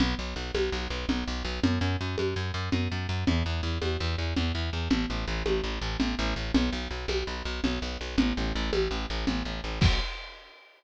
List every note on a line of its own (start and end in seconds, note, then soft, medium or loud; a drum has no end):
0.00 0.15 B1 loud
0.00 low conga loud
0.19 0.34 B1 medium
0.36 0.51 B1 loud
0.54 0.70 B1 loud
0.54 high conga loud
0.72 0.88 B1 loud
0.90 1.06 B1 loud
1.09 1.24 B1 loud
1.09 low conga loud
1.27 1.43 B1 loud
1.45 1.60 B1 loud
1.63 1.79 F#2 loud
1.63 low conga loud
1.81 1.97 F#2 loud
2.01 2.16 F#2 loud
2.18 2.34 F#2 medium
2.18 high conga medium
2.36 2.52 F#2 loud
2.54 2.69 F#2 loud
2.72 2.88 F#2 loud
2.72 low conga loud
2.92 3.07 F#2 medium
3.09 3.24 F#2 loud
3.27 3.43 E2 loud
3.27 low conga loud
3.46 3.61 E2 medium
3.63 3.78 E2 loud
3.82 3.97 E2 loud
3.82 high conga medium
4.00 4.16 E2 loud
4.18 4.34 E2 medium
4.37 4.52 E2 loud
4.37 low conga medium
4.55 4.70 E2 loud
4.73 4.88 E2 medium
4.90 5.06 A1 loud
4.90 low conga loud
5.10 5.25 A1 medium
5.27 5.43 A1 loud
5.46 5.61 A1 medium
5.46 high conga loud
5.64 5.79 A1 medium
5.82 5.97 A1 loud
6.00 6.15 A1 loud
6.00 low conga loud
6.19 6.34 A1 loud
6.36 6.52 A1 medium
6.54 6.70 B1 loud
6.54 low conga loud
6.72 6.88 B1 loud
6.91 7.06 B1 medium
7.08 7.24 B1 loud
7.08 high conga medium
7.27 7.43 B1 medium
7.45 7.61 B1 loud
7.64 7.79 B1 loud
7.64 low conga loud
7.82 7.98 B1 loud
8.01 8.16 B1 medium
8.18 8.33 A1 loud
8.18 low conga loud
8.37 8.53 A1 loud
8.55 8.71 A1 loud
8.73 8.88 A1 loud
8.73 high conga loud
8.91 9.06 A1 loud
9.10 9.25 A1 loud
9.27 9.43 A1 loud
9.27 low conga loud
9.45 9.61 A1 medium
9.64 9.79 A1 medium
9.81 10.00 B1 loud
9.81 kick loud
9.81 crash loud